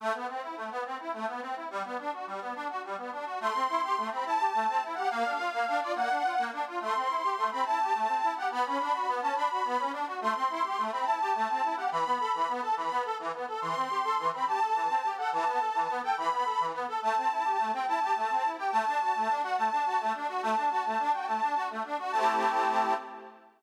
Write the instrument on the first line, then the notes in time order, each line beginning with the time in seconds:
accordion
0.00 A3
0.14 B3
0.28 C4
0.42 E4
0.57 A3
0.71 B3
0.85 C4
0.99 E4
1.13 A3
1.28 B3
1.42 C4
1.56 E4
1.70 G3
1.84 B3
1.99 D4
2.13 F#4
2.27 G3
2.41 B3
2.55 D4
2.70 F#4
2.84 G3
2.98 B3
3.12 D4
3.26 F#4
3.40 A3 C6
3.55 C4
3.69 E4
3.83 G4
3.97 A3
4.11 C4 B5
4.25 E4 A5
4.40 G4
4.54 A3
4.68 C4
4.82 E4
4.95 G4 F#5
5.10 A#3 F5
5.25 D4
5.39 F4
5.53 A#3
5.67 D4
5.81 F4 D5
5.95 A#3 F#5
6.10 D4
6.24 F4
6.38 A#3
6.52 D4
6.67 F4
6.81 A3 C6
6.95 C4
7.09 E4
7.23 G4
7.38 A3
7.51 C4 B5
7.65 E4 A5
7.80 G4
7.94 A3
8.09 C4
8.23 E4
8.36 G4 F#5
8.51 B3 B5
8.65 C#4
8.79 D4
8.94 F#4
9.08 B3
9.22 C#4 A5
9.35 D4 B5
9.50 F#4
9.65 B3
9.79 C#4
9.93 D4
10.07 F#4
10.21 A3 C6
10.35 C4
10.50 E4
10.64 G4
10.78 A3
10.92 C4 B5
11.05 E4 A5
11.21 G4
11.35 A3
11.49 C4
11.63 E4
11.77 G4 F#5
11.91 E3 B5
12.06 B3
12.20 A4
12.34 E3
12.48 B3
12.62 A4 A5
12.77 E3 B5
12.91 B3
13.05 A4
13.19 E3
13.33 B3
13.48 A4
13.61 E3 C6
13.76 C4
13.90 G4
14.04 A4
14.18 E3
14.33 C4 B5
14.47 G4 A5
14.61 A4
14.75 E3
14.89 C4
15.04 G4
15.17 A4 F#5
15.32 E3 A5
15.46 B3
15.60 A4
15.75 E3
15.89 B3
16.03 A4 G5
16.17 E3 B5
16.31 B3
16.45 A4
16.60 E3
16.74 B3
16.88 A4
17.02 A3 A5
17.16 C4
17.31 E4
17.45 G4
17.59 A3
17.73 C4 G5
17.87 E4 A5
18.01 G4
18.16 A3
18.30 C4
18.44 E4
18.58 G4 G5
18.71 A3 A5
18.87 D4
19.01 F#4
19.15 A3
19.29 D4
19.43 F#4 F#5
19.57 A3 A5
19.72 D4
19.86 F#4
20.00 A3
20.14 D4
20.28 F#4
20.42 A3 A5
20.57 D4
20.71 F#4
20.85 A3
20.99 D4
21.13 F#4 G5
21.27 A3 A5
21.42 D4
21.56 F#4
21.70 A3
21.84 D4
21.99 F#4
22.12 A3 C4 A5
22.17 E4 G4